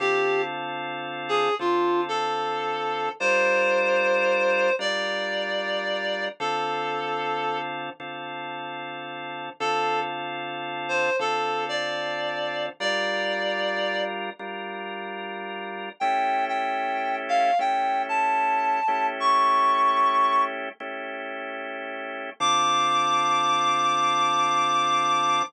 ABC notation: X:1
M:4/4
L:1/8
Q:"Swing" 1/4=75
K:Dm
V:1 name="Clarinet"
G z2 _A F =A3 | c4 d4 | A3 z5 | A z2 c A d3 |
d3 z5 | g g2 f g a3 | ^c'3 z5 | d'8 |]
V:2 name="Drawbar Organ"
[D,CFA]4 [D,CFA]4 | [G,DFB]4 [G,DFB]4 | [D,CFA]4 [D,CFA]4 | [D,CFA]4 [D,CFA]4 |
[G,DFB]4 [G,DFB]4 | [A,^CEG]4 [A,CEG]3 [A,CEG]- | [A,^CEG]4 [A,CEG]4 | [D,CFA]8 |]